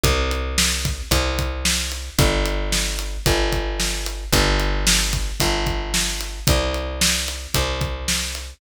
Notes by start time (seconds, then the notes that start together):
0.04 C2, kick, closed hi-hat
0.31 closed hi-hat
0.58 snare
0.85 kick, closed hi-hat
1.11 C2, kick, closed hi-hat
1.39 kick, closed hi-hat
1.65 snare
1.92 closed hi-hat
2.19 G1, kick, closed hi-hat
2.46 closed hi-hat
2.72 snare
2.99 closed hi-hat
3.26 G1, kick, closed hi-hat
3.52 kick, closed hi-hat
3.80 snare
4.06 closed hi-hat
4.32 G1, kick, closed hi-hat
4.60 closed hi-hat
4.87 snare
5.13 kick, closed hi-hat
5.40 G1, kick, closed hi-hat
5.67 kick, closed hi-hat
5.94 snare
6.21 closed hi-hat
6.47 C2, kick, closed hi-hat
6.74 closed hi-hat
7.01 snare
7.28 closed hi-hat
7.54 C2, kick, closed hi-hat
7.81 kick, closed hi-hat
8.08 snare
8.35 closed hi-hat